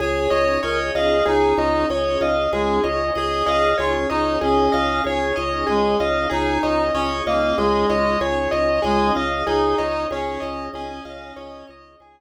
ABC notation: X:1
M:5/4
L:1/16
Q:1/4=95
K:Db
V:1 name="Acoustic Grand Piano"
A2 e2 d2 e2 A2 e2 d2 e2 A2 e2 | A2 e2 d2 e2 A2 e2 d2 e2 A2 e2 | A2 e2 d2 e2 A2 e2 d2 e2 A2 e2 | A2 e2 d2 e2 A2 e2 d2 e2 A2 z2 |]
V:2 name="Clarinet"
d4 B z A2 E4 z4 A,2 z2 | A4 F z E2 D4 z4 A,2 z2 | E4 D z B,2 A,4 z4 A,2 z2 | E4 D4 D6 z6 |]
V:3 name="Drawbar Organ"
A2 d2 e2 f2 A2 d2 e2 f2 A2 d2 | e2 f2 A2 d2 e2 f2 A2 d2 e2 f2 | A2 d2 e2 f2 e2 d2 A2 d2 e2 f2 | e2 d2 A2 d2 e2 f2 e2 d2 A2 z2 |]
V:4 name="Drawbar Organ" clef=bass
D,,2 D,,2 D,,2 D,,2 D,,2 D,,2 D,,2 D,,2 D,,2 D,,2 | D,,2 D,,2 D,,2 D,,2 D,,2 D,,2 D,,2 D,,2 D,,2 D,,2 | D,,2 D,,2 D,,2 D,,2 D,,2 D,,2 D,,2 D,,2 D,,2 D,,2 | D,,2 D,,2 D,,2 D,,2 D,,2 D,,2 D,,2 D,,2 D,,2 z2 |]
V:5 name="Pad 5 (bowed)"
[DEFA]20 | [DEAd]20 | [DEFA]20 | [DEAd]20 |]